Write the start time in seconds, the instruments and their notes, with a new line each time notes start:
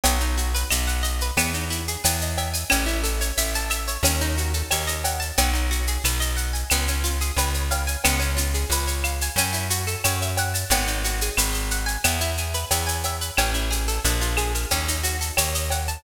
0.03 electric bass (finger) B1, acoustic guitar (steel) B3, cowbell, shaker
0.20 acoustic guitar (steel) D#4, shaker
0.37 acoustic guitar (steel) F#4, shaker
0.54 acoustic guitar (steel) B4, shaker
0.70 electric bass (finger) B1, acoustic guitar (steel) D#5, claves, shaker
0.87 acoustic guitar (steel) F#5, shaker
1.03 acoustic guitar (steel) D#5, shaker
1.21 acoustic guitar (steel) B4, shaker
1.37 electric bass (finger) E2, acoustic guitar (steel) B3, cowbell, claves, shaker
1.54 acoustic guitar (steel) D#4, shaker
1.70 acoustic guitar (steel) E4, shaker
1.88 acoustic guitar (steel) G#4, shaker
2.04 electric bass (finger) E2, acoustic guitar (steel) B4, cowbell, shaker
2.21 acoustic guitar (steel) D#5, shaker
2.37 acoustic guitar (steel) E5, cowbell, shaker
2.53 acoustic guitar (steel) G#5, shaker
2.69 electric bass (finger) A1, acoustic guitar (steel) C#4, cowbell, claves, shaker
2.86 acoustic guitar (steel) E4, shaker
3.03 acoustic guitar (steel) A4, shaker
3.21 acoustic guitar (steel) C#5, shaker
3.37 electric bass (finger) A1, acoustic guitar (steel) E5, shaker
3.55 acoustic guitar (steel) A5, shaker
3.70 acoustic guitar (steel) E5, claves, shaker
3.88 acoustic guitar (steel) C#5, shaker
4.03 electric bass (finger) D#2, acoustic guitar (steel) C#4, cowbell, shaker
4.21 acoustic guitar (steel) D#4, shaker
4.37 acoustic guitar (steel) F#4, shaker
4.53 acoustic guitar (steel) A4, shaker
4.71 electric bass (finger) D#2, acoustic guitar (steel) C#5, cowbell, claves, shaker
4.87 acoustic guitar (steel) D#5, shaker
5.04 acoustic guitar (steel) F#5, cowbell, shaker
5.20 acoustic guitar (steel) A5, shaker
5.38 electric bass (finger) B1, acoustic guitar (steel) B3, cowbell, shaker
5.53 acoustic guitar (steel) D#4, shaker
5.71 acoustic guitar (steel) F#4, shaker
5.87 acoustic guitar (steel) G#4, shaker
6.04 electric bass (finger) B1, acoustic guitar (steel) B4, claves, shaker
6.20 acoustic guitar (steel) D#5, shaker
6.36 acoustic guitar (steel) F#5, shaker
6.53 acoustic guitar (steel) G#5, shaker
6.70 electric bass (finger) C#2, acoustic guitar (steel) B3, cowbell, claves, shaker
6.88 acoustic guitar (steel) C#4, shaker
7.04 acoustic guitar (steel) F4, shaker
7.21 acoustic guitar (steel) G#4, shaker
7.36 electric bass (finger) C#2, acoustic guitar (steel) B4, cowbell, shaker
7.54 acoustic guitar (steel) C#5, shaker
7.71 acoustic guitar (steel) F5, cowbell, shaker
7.87 acoustic guitar (steel) G#5, shaker
8.04 electric bass (finger) C#2, acoustic guitar (steel) B3, cowbell, claves, shaker
8.19 acoustic guitar (steel) C#4, shaker
8.37 acoustic guitar (steel) F4, shaker
8.54 acoustic guitar (steel) G#4, shaker
8.69 electric bass (finger) C#2, acoustic guitar (steel) B4, shaker
8.87 acoustic guitar (steel) C#5, shaker
9.04 acoustic guitar (steel) F5, claves, shaker
9.21 acoustic guitar (steel) G#5, shaker
9.36 electric bass (finger) F#2, acoustic guitar (steel) C#4, cowbell, shaker
9.53 acoustic guitar (steel) E4, shaker
9.70 acoustic guitar (steel) F#4, shaker
9.87 acoustic guitar (steel) A4, shaker
10.04 electric bass (finger) F#2, acoustic guitar (steel) C#5, cowbell, claves, shaker
10.22 acoustic guitar (steel) E5, shaker
10.37 acoustic guitar (steel) F#5, cowbell, shaker
10.54 acoustic guitar (steel) A5, shaker
10.70 electric bass (finger) G#1, acoustic guitar (steel) B3, cowbell, shaker
10.87 acoustic guitar (steel) D#4, shaker
11.04 acoustic guitar (steel) F#4, shaker
11.21 acoustic guitar (steel) G#4, shaker
11.37 electric bass (finger) G#1, acoustic guitar (steel) B4, claves, shaker
11.53 acoustic guitar (steel) D#5, shaker
11.71 acoustic guitar (steel) F#5, shaker
11.86 acoustic guitar (steel) G#5, shaker
12.04 electric bass (finger) E2, acoustic guitar (steel) B3, cowbell, claves, shaker
12.21 acoustic guitar (steel) E4, shaker
12.37 acoustic guitar (steel) G#4, shaker
12.54 acoustic guitar (steel) B4, shaker
12.71 electric bass (finger) E2, acoustic guitar (steel) E5, cowbell, shaker
12.87 acoustic guitar (steel) G#5, shaker
13.03 acoustic guitar (steel) E5, cowbell, shaker
13.21 acoustic guitar (steel) B4, shaker
13.37 electric bass (finger) A1, acoustic guitar (steel) C#4, cowbell, claves, shaker
13.54 acoustic guitar (steel) E4, shaker
13.70 acoustic guitar (steel) G#4, shaker
13.88 acoustic guitar (steel) A4, shaker
14.04 electric bass (finger) A#1, acoustic guitar (steel) D4, shaker
14.21 acoustic guitar (steel) F4, shaker
14.37 acoustic guitar (steel) G#4, claves, shaker
14.55 acoustic guitar (steel) A#4, shaker
14.71 electric bass (finger) D#2, acoustic guitar (steel) C#4, cowbell, shaker
14.88 acoustic guitar (steel) D#4, shaker
15.03 acoustic guitar (steel) F#4, shaker
15.21 acoustic guitar (steel) A4, shaker
15.37 electric bass (finger) D#2, acoustic guitar (steel) C#5, cowbell, claves, shaker
15.55 acoustic guitar (steel) D#5, shaker
15.70 acoustic guitar (steel) F#5, cowbell, shaker
15.88 acoustic guitar (steel) A5, shaker